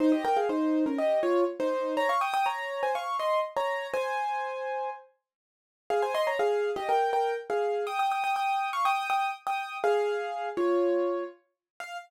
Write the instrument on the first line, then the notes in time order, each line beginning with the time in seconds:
acoustic grand piano
0.00 D#4 C5
0.12 G4 D#5
0.25 A#4 G5
0.37 G#4 F5
0.49 D#4 C5
0.86 C#4 A#4
0.98 G4 D#5
1.23 F4 C#5
1.60 D#4 C5
1.97 C#5 A#5
2.09 F5 C#6
2.21 G5 D#6
2.34 G5 D#6
2.46 C#5 A#5
2.83 C5 G#5
2.95 F5 C#6
3.19 D#5 C6
3.57 C#5 A#5
3.94 C5 G#5
5.90 G#4 F5
6.02 C5 G#5
6.15 D#5 C6
6.27 C#5 A#5
6.39 G#4 F5
6.76 G4 D#5
6.89 A#4 G5
7.13 A#4 G5
7.50 G#4 F5
7.87 G5 D#6
7.99 G5 D#6
8.12 G5 D#6
8.24 G5 D#6
8.36 G5 D#6
8.73 F5 C#6
8.85 G5 D#6
9.10 G5 D#6
9.47 G5 D#6
9.84 G#4 F5
10.57 F4 C#5
11.80 F5